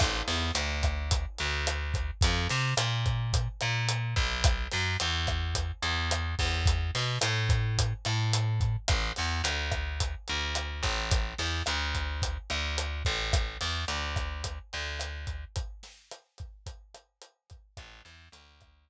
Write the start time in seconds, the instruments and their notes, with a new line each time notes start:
0.00 electric bass (finger) A1, kick, cross-stick, crash
0.28 electric bass (finger) E2, snare, closed hi-hat
0.55 electric bass (finger) D2, closed hi-hat
0.83 kick, cross-stick, closed hi-hat
1.11 kick, closed hi-hat
1.38 electric bass (finger) D2, closed hi-hat
1.67 cross-stick, closed hi-hat
1.94 kick, closed hi-hat
2.21 electric bass (finger) F2, kick, closed hi-hat
2.50 electric bass (finger) C3, snare, closed hi-hat
2.77 electric bass (finger) A#2, cross-stick, closed hi-hat
3.06 kick, closed hi-hat
3.33 kick, closed hi-hat
3.61 electric bass (finger) A#2, cross-stick, closed hi-hat
3.89 closed hi-hat
4.16 electric bass (finger) B1, kick, closed hi-hat
4.44 kick, cross-stick, closed hi-hat
4.72 electric bass (finger) F#2, snare, closed hi-hat
5.00 electric bass (finger) E2, closed hi-hat
5.27 kick, cross-stick, closed hi-hat
5.55 kick, closed hi-hat
5.82 electric bass (finger) E2, closed hi-hat
6.11 cross-stick, closed hi-hat
6.39 electric bass (finger) E2, kick, open hi-hat
6.66 kick, closed hi-hat
6.95 electric bass (finger) B2, snare, closed hi-hat
7.21 electric bass (finger) A2, cross-stick, closed hi-hat
7.49 kick, closed hi-hat
7.78 kick, closed hi-hat
8.05 electric bass (finger) A2, cross-stick, closed hi-hat
8.33 closed hi-hat
8.61 kick, closed hi-hat
8.88 electric bass (finger) A1, kick, cross-stick, closed hi-hat
9.16 electric bass (finger) E2, snare, closed hi-hat
9.44 electric bass (finger) D2, closed hi-hat
9.72 kick, cross-stick, closed hi-hat
10.00 kick, closed hi-hat
10.28 electric bass (finger) D2, closed hi-hat
10.55 cross-stick, closed hi-hat
10.83 electric bass (finger) A1, kick, closed hi-hat
11.11 kick, closed hi-hat
11.38 electric bass (finger) E2, snare, closed hi-hat
11.66 electric bass (finger) D2, cross-stick, closed hi-hat
11.95 kick, closed hi-hat
12.22 kick, closed hi-hat
12.50 electric bass (finger) D2, cross-stick, closed hi-hat
12.78 closed hi-hat
13.05 electric bass (finger) A1, kick, closed hi-hat
13.33 kick, cross-stick, closed hi-hat
13.61 electric bass (finger) E2, snare, closed hi-hat
13.88 electric bass (finger) D2, closed hi-hat
14.16 kick, cross-stick, closed hi-hat
14.44 kick, closed hi-hat
14.73 electric bass (finger) D2, closed hi-hat
15.00 cross-stick, closed hi-hat
15.27 kick, closed hi-hat
15.56 kick, closed hi-hat
15.83 snare, closed hi-hat
16.11 cross-stick, closed hi-hat
16.38 kick, closed hi-hat
16.66 kick, closed hi-hat
16.94 cross-stick, closed hi-hat
17.22 closed hi-hat
17.50 kick, closed hi-hat
17.77 electric bass (finger) A1, kick, cross-stick, closed hi-hat
18.05 electric bass (finger) E2, snare, closed hi-hat
18.32 electric bass (finger) D2, closed hi-hat
18.61 kick, cross-stick, closed hi-hat